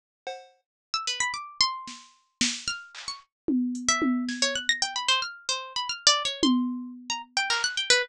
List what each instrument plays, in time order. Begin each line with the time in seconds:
0.27 cowbell
0.94 harpsichord E6
1.07 harpsichord B4
1.20 harpsichord B5
1.34 harpsichord D6
1.61 harpsichord C6
1.87 snare
2.41 snare
2.68 harpsichord F6
2.95 clap
3.08 harpsichord C#6
3.48 high tom
3.75 closed hi-hat
3.89 harpsichord E5
4.02 high tom
4.29 harpsichord G#6, snare
4.42 harpsichord C#5
4.55 harpsichord F#6
4.69 harpsichord A#6
4.82 harpsichord G5
4.96 harpsichord B5
5.08 harpsichord C5
5.22 harpsichord F6
5.49 harpsichord C5
5.76 harpsichord B5
5.89 harpsichord F6
6.07 harpsichord D5
6.25 harpsichord C#5
6.43 harpsichord C6, high tom
7.10 harpsichord A#5
7.37 harpsichord G5
7.50 harpsichord A#4, clap
7.64 harpsichord F#6
7.77 harpsichord G5
7.90 harpsichord B4